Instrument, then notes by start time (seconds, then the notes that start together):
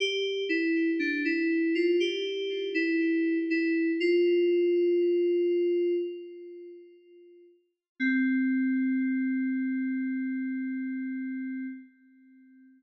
electric piano 2
0.00 G4
0.49 E4
0.99 D4
1.25 E4
1.75 F4
2.00 G4
2.74 E4
3.50 E4
4.00 F4
8.00 C4